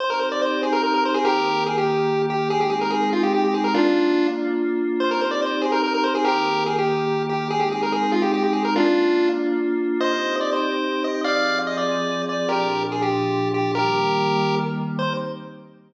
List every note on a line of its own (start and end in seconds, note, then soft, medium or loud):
0.00 1.24 C4 loud
0.00 1.24 D#4 medium
0.00 1.24 G4 medium
0.00 0.10 C5 loud
0.10 0.20 A#4 medium
0.19 0.29 C5 medium
0.32 0.42 D5 medium
0.42 0.61 C5 medium
0.63 0.73 G#4 medium
0.73 0.82 A#4 loud
0.83 0.93 A#4 loud
0.94 1.04 A#4 loud
1.05 1.15 C5 medium
1.14 1.24 G#4 loud
1.25 2.49 D#3 medium
1.25 2.49 A#3 medium
1.25 1.64 G4 medium
1.25 2.49 G4 medium
1.25 1.64 A#4 loud
1.66 1.76 G#4 medium
1.78 2.22 G4 medium
2.30 2.49 G4 medium
2.50 3.74 G#3 loud
2.50 3.74 C4 loud
2.50 3.74 D#4 loud
2.50 2.60 G#4 loud
2.61 2.71 G4 medium
2.70 2.80 G#4 medium
2.81 2.91 A#4 medium
2.90 3.10 G#4 loud
3.13 3.23 F4 medium
3.23 3.33 G4 medium
3.34 3.44 G4 loud
3.45 3.54 G4 medium
3.54 3.64 G#4 medium
3.64 3.74 A#4 loud
3.74 4.99 A#3 medium
3.74 4.27 D4 loud
3.74 4.99 D4 medium
3.74 4.27 F4 loud
3.74 4.99 F4 loud
5.00 6.24 C4 loud
5.00 6.24 D#4 medium
5.00 6.24 G4 medium
5.00 5.10 C5 loud
5.11 5.21 A#4 medium
5.21 5.31 C5 medium
5.31 5.41 D5 medium
5.42 5.62 C5 medium
5.61 5.71 G#4 medium
5.72 5.82 A#4 loud
5.84 5.93 A#4 loud
5.94 6.04 A#4 loud
6.04 6.14 C5 medium
6.15 6.25 G#4 loud
6.25 7.49 D#3 medium
6.25 7.49 A#3 medium
6.25 6.64 G4 medium
6.25 7.49 G4 medium
6.25 6.64 A#4 loud
6.66 6.76 G#4 medium
6.78 7.23 G4 medium
7.29 7.48 G4 medium
7.50 8.74 G#3 loud
7.50 8.74 C4 loud
7.50 8.74 D#4 loud
7.50 7.60 G#4 loud
7.59 7.69 G4 medium
7.72 7.82 G#4 medium
7.83 7.93 A#4 medium
7.92 8.12 G#4 loud
8.12 8.22 F4 medium
8.22 8.32 G4 medium
8.34 8.43 G4 loud
8.44 8.53 G4 medium
8.53 8.63 G#4 medium
8.65 8.75 A#4 loud
8.75 9.99 A#3 medium
8.75 9.99 D4 medium
8.75 9.29 D4 loud
8.75 9.99 F4 loud
8.75 9.29 F4 loud
10.00 11.24 C4 medium
10.00 11.24 D#4 medium
10.00 11.24 G4 medium
10.00 10.36 C5 loud
10.00 10.36 D#5 loud
10.41 10.50 D5 medium
10.53 11.03 C5 medium
11.04 11.21 D#5 medium
11.24 12.49 F3 loud
11.24 12.49 C4 loud
11.24 12.49 G#4 loud
11.24 11.59 D5 medium
11.24 11.59 F5 loud
11.67 11.77 D#5 loud
11.77 12.22 D5 loud
12.29 12.49 D5 medium
12.49 13.74 A#2 medium
12.49 13.74 F3 loud
12.49 13.74 D4 medium
12.49 12.83 G4 medium
12.49 12.83 A#4 medium
12.92 13.02 G#4 medium
13.02 13.49 G4 medium
13.54 13.72 G4 medium
13.75 14.99 D#3 loud
13.75 14.99 G3 medium
13.75 14.99 A#3 medium
13.75 14.55 G4 medium
13.75 14.55 A#4 loud
14.99 15.14 C4 medium
14.99 15.14 D#4 loud
14.99 15.14 G4 loud
14.99 15.13 C5 loud